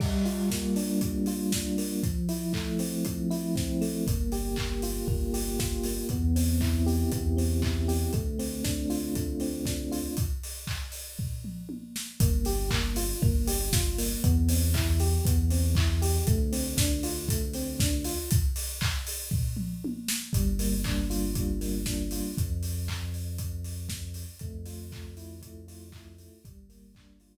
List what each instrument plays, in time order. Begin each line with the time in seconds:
0.00 electric piano 1 G3, kick, crash
0.25 electric piano 1 F4, open hi-hat
0.50 electric piano 1 A#3, kick, snare
0.76 electric piano 1 D4, open hi-hat
1.01 electric piano 1 G3, kick, closed hi-hat
1.26 electric piano 1 F4, open hi-hat
1.52 electric piano 1 D4, kick, snare
1.78 electric piano 1 A#3, open hi-hat
2.03 electric piano 1 F3, kick, closed hi-hat
2.29 electric piano 1 E4, open hi-hat
2.53 electric piano 1 A3, kick, clap
2.79 electric piano 1 C4, open hi-hat
3.05 electric piano 1 F3, kick, closed hi-hat
3.31 electric piano 1 E4, open hi-hat
3.56 electric piano 1 C4, kick, snare
3.81 electric piano 1 A3, open hi-hat
4.07 synth bass 2 G1, electric piano 1 A#3, kick, closed hi-hat
4.32 electric piano 1 G4, open hi-hat
4.56 electric piano 1 A#3, kick, clap
4.82 electric piano 1 F4, open hi-hat
5.08 synth bass 2 G1, electric piano 1 A#3, kick
5.34 electric piano 1 G4, open hi-hat
5.59 electric piano 1 F4, kick, snare
5.83 electric piano 1 A#3, open hi-hat
6.09 synth bass 2 E2, electric piano 1 B3, kick, closed hi-hat
6.36 electric piano 1 C4, open hi-hat
6.61 electric piano 1 E4, kick, clap
6.86 electric piano 1 G4, open hi-hat
7.12 synth bass 2 E2, electric piano 1 B3, kick, closed hi-hat
7.37 electric piano 1 C4, open hi-hat
7.62 electric piano 1 E4, kick, clap
7.88 electric piano 1 G4, open hi-hat
8.13 synth bass 2 D2, electric piano 1 A3, kick, closed hi-hat
8.39 electric piano 1 C4, open hi-hat
8.64 electric piano 1 D4, kick, snare
8.90 electric piano 1 F4, open hi-hat
9.15 electric piano 1 A3, kick, closed hi-hat
9.40 electric piano 1 C4, open hi-hat
9.66 electric piano 1 D4, kick, snare
9.92 electric piano 1 F4, open hi-hat
10.17 kick, closed hi-hat
10.43 open hi-hat
10.67 kick, clap
10.92 open hi-hat
11.19 kick, floor tom
11.44 mid tom
11.69 high tom
11.96 snare
12.20 synth bass 2 G1, electric piano 1 A#3, kick, closed hi-hat
12.45 electric piano 1 G4, open hi-hat
12.71 electric piano 1 A#3, kick, clap
12.96 electric piano 1 F4, open hi-hat
13.22 synth bass 2 G1, electric piano 1 A#3, kick
13.47 electric piano 1 G4, open hi-hat
13.73 electric piano 1 F4, kick, snare
13.98 electric piano 1 A#3, open hi-hat
14.24 synth bass 2 E2, electric piano 1 B3, kick, closed hi-hat
14.49 electric piano 1 C4, open hi-hat
14.74 electric piano 1 E4, kick, clap
15.00 electric piano 1 G4, open hi-hat
15.25 synth bass 2 E2, electric piano 1 B3, kick, closed hi-hat
15.50 electric piano 1 C4, open hi-hat
15.75 electric piano 1 E4, kick, clap
16.02 electric piano 1 G4, open hi-hat
16.27 synth bass 2 D2, electric piano 1 A3, kick, closed hi-hat
16.52 electric piano 1 C4, open hi-hat
16.77 electric piano 1 D4, kick, snare
17.03 electric piano 1 F4, open hi-hat
17.29 electric piano 1 A3, kick, closed hi-hat
17.53 electric piano 1 C4, open hi-hat
17.80 electric piano 1 D4, kick, snare
18.04 electric piano 1 F4, open hi-hat
18.31 kick, closed hi-hat
18.56 open hi-hat
18.81 kick, clap
19.07 open hi-hat
19.31 kick, floor tom
19.57 mid tom
19.84 high tom
20.08 snare
20.33 synth bass 2 G1, electric piano 1 G3, kick, closed hi-hat
20.59 electric piano 1 A#3, open hi-hat
20.84 electric piano 1 D4, kick, clap
21.10 electric piano 1 F4, open hi-hat
21.35 electric piano 1 G3, kick, closed hi-hat
21.61 electric piano 1 A#3, open hi-hat
21.86 electric piano 1 D4, kick, snare
22.11 electric piano 1 F4, open hi-hat
22.38 synth bass 2 F2, kick, closed hi-hat
22.63 open hi-hat
22.88 kick, clap
23.14 open hi-hat
23.38 kick, closed hi-hat
23.64 open hi-hat
23.89 kick, snare
24.14 open hi-hat
24.39 synth bass 2 F2, electric piano 1 A3, kick, closed hi-hat
24.66 electric piano 1 F4, open hi-hat
24.92 electric piano 1 A3, kick, clap
25.17 electric piano 1 E4, open hi-hat
25.42 electric piano 1 A3, kick, closed hi-hat
25.68 electric piano 1 F4, open hi-hat
25.92 electric piano 1 E4, kick, clap
26.18 electric piano 1 A3, open hi-hat
26.44 synth bass 2 G1, electric piano 1 G3, kick, closed hi-hat
26.69 electric piano 1 A#3, open hi-hat
26.95 electric piano 1 D4, kick, clap
27.20 electric piano 1 F4, open hi-hat